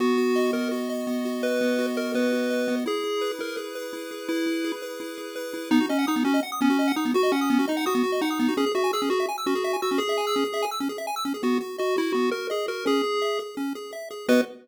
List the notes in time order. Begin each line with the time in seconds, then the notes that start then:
0.00 B3 F#4
0.18 F#4
0.36 D#5
0.53 B3 A#4
0.71 F#4
0.89 D#5
1.07 B3
1.25 F#4
1.43 B4 D#5
1.61 B3
1.79 F#4
1.96 A#4 D#5
2.14 B3 B4
2.32 F#4
2.50 D#5
2.68 B3
2.86 E4 G#4
3.04 G#4
3.21 B4
3.39 E4 A#4
3.57 G#4
3.75 B4
3.93 E4
4.11 G#4
4.28 E4 B4
4.46 E4
4.64 G#4
4.82 B4
5.00 E4
5.18 G#4
5.36 B4
5.54 E4
5.71 B3 D#4
5.80 F#4
5.89 C#4 D#5
5.99 F#5
6.07 D#4 D#6
6.16 B3
6.24 C#4 F#4
6.34 D#5
6.43 F#5
6.52 D#6
6.61 B3 C#4
6.70 F#4
6.79 D#5
6.88 F#5
6.96 D#4 D#6
7.05 B3
7.14 F#4
7.23 D#5
7.32 C#4 F#5
7.41 D#6
7.50 B3
7.59 F#4
7.68 D#4 D#5
7.77 F#5
7.86 F#4 D#6
7.95 B3
8.03 F#4
8.12 D#5
8.21 D#4 F#5
8.30 D#6
8.39 B3
8.48 F#4
8.57 C#4 G#4
8.66 G#4
8.75 F#4 E5
8.84 G#5
8.93 G#4 E6
9.02 C#4
9.10 F#4 G#4
9.20 E5
9.28 G#5
9.38 E6
9.46 C#4 F#4
9.55 G#4
9.64 E5
9.73 G#5
9.82 F#4 E6
9.91 C#4
9.98 G#4
10.09 E5
10.18 G#5
10.27 E6
10.36 C#4
10.44 G#4
10.54 E5
10.62 G#5
10.71 E6
10.80 C#4
10.89 G#4
10.98 E5
11.07 G#5
11.16 E6
11.25 C#4
11.34 G#4
11.43 B3 F#4
11.61 F#4
11.78 F#4 D#5
11.96 E4 F#4
12.12 B3 F#4
12.31 F#4 A#4
12.50 G#4 D#5
12.68 F#4 A#4
12.86 C#4 G#4
13.03 G#4
13.22 E5
13.39 G#4
13.57 C#4
13.75 G#4
13.93 E5
14.11 G#4
14.28 B3 F#4 B4 D#5